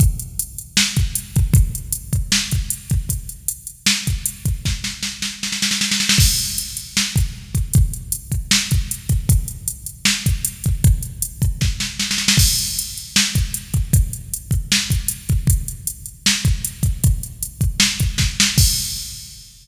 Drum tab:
CC |----------------|----------------|----------------|----------------|
HH |x-x-x-x---x-x-x-|x-x-x-x---x-x-x-|x-x-x-x---x-x-x-|----------------|
SD |--------o-------|--------o-------|--------o-------|o-o-o-o-oooooooo|
BD |o---------o---o-|o-----o---o---o-|o---------o---o-|o---------------|

CC |x---------------|----------------|----------------|----------------|
HH |--x-x-x---x---x-|x-x-x-x---x-x-x-|x-x-x-x---x-x-x-|x-x-x-x---------|
SD |--------o-------|--------o-------|--------o-------|--------o-o-oooo|
BD |o---------o---o-|o-----o---o---o-|o---------o---o-|o-----o-o-------|

CC |x---------------|----------------|----------------|----------------|
HH |--x-x-x---x-x-x-|x-x-x-x---x-x-x-|x-x-x-x---x-x-x-|x-x-x-x---x-----|
SD |--------o-------|--------o-------|--------o-------|--------o---o-o-|
BD |o---------o---o-|o-----o---o---o-|o---------o---o-|o-----o---o-o---|

CC |x---------------|
HH |----------------|
SD |----------------|
BD |o---------------|